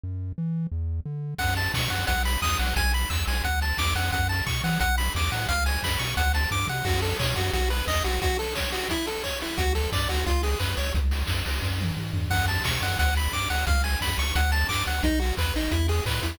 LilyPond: <<
  \new Staff \with { instrumentName = "Lead 1 (square)" } { \time 4/4 \key fis \minor \tempo 4 = 176 r1 | fis''8 a''8 cis'''8 fis''8 fis''8 b''8 dis'''8 fis''8 | gis''8 b''8 e'''8 gis''8 fis''8 a''8 d'''8 fis''8 | fis''8 a''8 cis'''8 fis''8 fis''8 b''8 d'''8 fis''8 |
eis''8 gis''8 b''8 cis'''8 fis''8 a''8 d'''8 fis''8 | fis'8 a'8 cis''8 fis'8 fis'8 b'8 dis''8 fis'8 | fis'8 a'8 cis''8 fis'8 e'8 a'8 cis''8 e'8 | fis'8 a'8 d''8 fis'8 eis'8 gis'8 b'8 cis''8 |
r1 | fis''8 a''8 cis'''8 fis''8 fis''8 b''8 d'''8 fis''8 | eis''8 gis''8 b''8 cis'''8 fis''8 a''8 d'''8 fis''8 | dis'8 fis'8 b'8 dis'8 e'8 gis'8 b'8 e'8 | }
  \new Staff \with { instrumentName = "Synth Bass 1" } { \clef bass \time 4/4 \key fis \minor fis,4 e4 e,4 d4 | fis,4 b,8 fis,8 b,,4 e,8 b,,8 | b,,4 e,8 b,,8 d,4 e,8 eis,8 | fis,4 b,8 e8 b,,4 e,8 a,8 |
cis,4 fis,8 b,8 d,4 g,8 c8 | fis,4 b,8 fis,8 b,,4 e,8 b,,8 | r1 | d,4 g,8 d,8 cis,4 fis,8 cis,8 |
cis,4 fis,8 cis,8 fis,4 gis,8 g,8 | fis,4 b,8 fis,8 d,4 g,8 d,8 | cis,4 fis,8 cis,8 d,4 g,8 d,8 | b,,4 e,8 a,,8 e,4 a,8 e,8 | }
  \new DrumStaff \with { instrumentName = "Drums" } \drummode { \time 4/4 r4 r4 r4 r4 | <cymc bd>8 hho8 <bd sn>8 hho8 <hh bd>8 hho8 <bd sn>8 hho8 | <hh bd>8 hho8 <hc bd>8 hho8 <hh bd>8 hho8 <bd sn>8 hho8 | <hh bd>8 hho8 <hc bd>8 hho8 <hh bd>8 hho8 <bd sn>8 hho8 |
<hh bd>8 hho8 <bd sn>8 hho8 <hh bd>8 hho8 <bd sn>8 toml8 | <cymc bd>8 hho8 <hc bd>8 hho8 <hh bd>8 hho8 <hc bd>8 hho8 | <hh bd>8 hho8 <bd sn>8 hho8 <hh bd>8 hho8 <hc bd>8 hho8 | <hh bd>8 hho8 <hc bd>8 hho8 <hh bd>8 hho8 <hc bd>8 hho8 |
<hh bd>8 hho8 <bd sn>8 hho8 <bd sn>8 tommh8 toml8 tomfh8 | <cymc bd>8 hho8 <bd sn>8 hho8 <hh bd>8 hho8 <bd sn>8 hho8 | <hh bd>8 hho8 <bd sn>8 hho8 <hh bd>8 hho8 <hc bd>8 hho8 | <hh bd>8 hho8 <hc bd>8 hho8 <hh bd>8 hho8 <hc bd>8 hho8 | }
>>